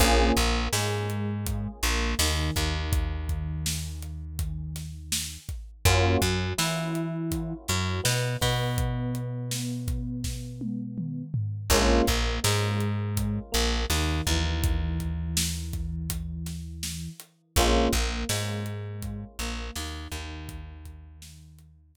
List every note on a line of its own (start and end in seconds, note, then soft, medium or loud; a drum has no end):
0.00 0.32 A#1 medium
0.00 0.33 A#3 medium
0.00 0.33 C#4 medium
0.00 0.33 F4 medium
0.00 0.33 G#4 medium
0.00 kick loud
0.00 closed hi-hat loud
0.37 0.68 A#1 medium
0.37 0.68 A#3 medium
0.37 kick medium
0.37 closed hi-hat medium
0.73 1.68 G#2 medium
0.73 1.68 G#3 medium
0.73 snare loud
1.10 closed hi-hat medium
1.46 kick medium
1.46 closed hi-hat loud
1.83 2.15 A#1 medium
1.83 2.15 A#3 medium
1.83 snare medium
1.83 closed hi-hat medium
2.19 2.51 D#2 medium
2.19 2.52 D#3 medium
2.19 snare loud
2.56 5.38 D#2 medium
2.56 5.37 D#3 medium
2.56 kick medium
2.56 closed hi-hat medium
2.93 kick loud
2.93 closed hi-hat loud
3.29 kick medium
3.29 closed hi-hat medium
3.66 snare loud
4.02 closed hi-hat medium
4.39 kick medium
4.39 closed hi-hat medium
4.76 snare medium
4.76 closed hi-hat medium
5.12 snare loud
5.49 kick medium
5.49 closed hi-hat medium
5.85 6.17 F#2 medium
5.85 6.19 A#3 medium
5.85 6.19 C#4 medium
5.85 6.19 F4 medium
5.85 6.19 F#4 medium
5.85 kick loud
5.85 closed hi-hat loud
6.21 6.53 F#2 medium
6.21 6.52 F#3 medium
6.21 kick medium
6.21 closed hi-hat medium
6.58 7.54 E3 medium
6.58 7.53 E4 medium
6.58 snare loud
6.95 closed hi-hat medium
7.32 kick medium
7.32 closed hi-hat loud
7.68 8.01 F#2 medium
7.68 8.01 F#3 medium
7.68 snare medium
7.68 closed hi-hat medium
8.04 8.37 B2 medium
8.04 8.36 B3 medium
8.04 snare loud
8.41 11.23 B2 medium
8.41 11.23 B3 medium
8.41 kick medium
8.41 open hi-hat medium
8.78 kick loud
8.78 closed hi-hat medium
9.15 closed hi-hat medium
9.51 snare loud
9.88 kick loud
9.88 closed hi-hat medium
10.24 kick medium
10.24 snare medium
10.61 high tom medium
10.98 mid tom medium
11.34 floor tom loud
11.70 12.02 A#1 medium
11.70 12.04 G#3 medium
11.70 12.04 A#3 medium
11.70 12.04 C#4 medium
11.70 12.04 F4 medium
11.70 kick loud
11.70 crash loud
12.07 12.39 A#1 medium
12.07 12.39 A#3 medium
12.07 kick medium
12.07 closed hi-hat medium
12.44 13.39 G#2 medium
12.44 13.39 G#3 medium
12.44 snare loud
12.80 closed hi-hat medium
13.17 kick medium
13.17 closed hi-hat loud
13.52 13.86 A#1 medium
13.52 13.84 A#3 medium
13.52 snare medium
13.52 closed hi-hat medium
13.90 14.21 D#2 medium
13.90 14.22 D#3 medium
13.90 snare medium
14.27 17.08 D#2 medium
14.27 17.09 E3 medium
14.27 kick medium
14.27 closed hi-hat medium
14.64 kick loud
14.64 closed hi-hat loud
15.00 kick medium
15.00 closed hi-hat medium
15.37 snare loud
15.73 kick medium
15.73 closed hi-hat medium
16.10 kick medium
16.10 closed hi-hat loud
16.46 snare medium
16.46 closed hi-hat medium
16.83 snare loud
17.20 closed hi-hat medium
17.56 17.88 A#1 medium
17.56 17.91 G#3 medium
17.56 17.91 A#3 medium
17.56 17.91 C#4 medium
17.56 17.91 F4 medium
17.56 kick loud
17.56 closed hi-hat loud
17.93 18.24 A#1 medium
17.93 18.25 A#3 medium
17.93 kick medium
17.93 closed hi-hat medium
18.29 19.24 G#2 medium
18.29 19.24 G#3 medium
18.29 snare loud
18.66 closed hi-hat medium
19.02 kick medium
19.02 closed hi-hat medium
19.39 19.71 A#1 medium
19.39 19.71 A#3 medium
19.39 snare medium
19.39 closed hi-hat medium
19.76 20.08 D#2 medium
19.76 20.09 D#3 medium
19.76 snare loud
20.12 21.96 D#2 medium
20.12 21.96 D#3 medium
20.12 kick medium
20.12 closed hi-hat medium
20.49 kick loud
20.49 closed hi-hat loud
20.85 kick medium
20.85 closed hi-hat medium
21.22 snare loud
21.59 closed hi-hat medium
21.95 kick medium
21.95 closed hi-hat loud